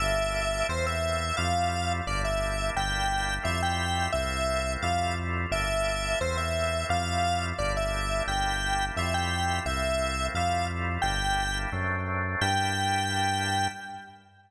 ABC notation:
X:1
M:2/2
L:1/8
Q:1/2=87
K:Gdor
V:1 name="Lead 1 (square)"
e4 c e3 | f4 d e3 | g4 e g3 | e4 f2 z2 |
e4 c e3 | f4 d e3 | g4 e g3 | e4 f2 z2 |
g4 z4 | g8 |]
V:2 name="Drawbar Organ"
[B,DEG]4 [A,B,CE]4 | [G,A,EF]4 [G,B,DE]4 | [G,B,DE]4 [G,A,EF]4 | [A,B,CE]4 [G,A,EF]4 |
[B,DEG]4 [A,B,CE]4 | [G,A,EF]4 [G,B,DE]4 | [G,B,DE]4 [G,A,EF]4 | [A,B,CE]4 [G,A,EF]4 |
[G,B,DE]4 [^F,A,CD]4 | [B,DEG]8 |]
V:3 name="Synth Bass 1" clef=bass
G,,,4 E,,4 | F,,4 G,,,4 | G,,,4 F,,4 | C,,4 F,,4 |
G,,,4 E,,4 | F,,4 G,,,4 | G,,,4 F,,4 | C,,4 F,,4 |
G,,,4 ^F,,4 | G,,8 |]